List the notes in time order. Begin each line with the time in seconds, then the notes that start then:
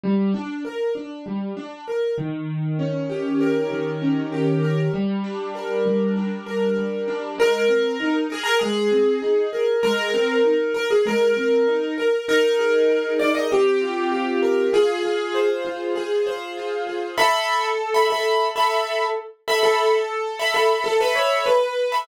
0.03 G3
0.34 D4
0.65 A#4
0.95 D4
1.26 G3
1.57 D4
1.88 A#4
2.18 D#3
2.79 C#4
3.10 G4
3.41 A#4
3.71 D#3
4.02 C#4
4.32 G4
4.63 A#4
4.94 G3
5.24 D4
5.55 A#4
5.86 G3
6.16 D4
6.46 A#4
6.77 G3
7.08 D4
7.38 G#3 A#4
7.68 C4
8.00 D#4
8.30 G#4 A#4
8.43 A#4
8.59 G#3 G#4
8.91 C4
9.22 D#4
9.53 A#4
9.83 G#3 A#4
10.14 C4
10.45 D#4
10.74 A#4
10.91 G#4
11.06 G#3 A#4
11.37 C4
11.67 D#4
11.98 A#4
12.28 D#4 A#4
12.59 G#4
12.90 A#4
13.19 D#4 D5
13.35 D#5
13.51 C4 G4
13.81 F4
14.12 G4
14.42 A#4
14.73 F4 G#4
15.03 G#4
15.34 C5
15.65 F4
15.96 G#4
16.27 C5
16.57 F4
16.87 G#4
17.18 A4 E5 B5
17.94 A4 E5 B5
18.10 A4 E5 B5
18.56 A4 E5 B5
19.48 A4 E5 B5
19.63 A4
20.39 A4 E5 B5
20.54 A4 E5 B5
20.84 A4
21.00 A4 B4 E5 B5
21.15 C#5
21.46 B4
21.92 A4 E5 B5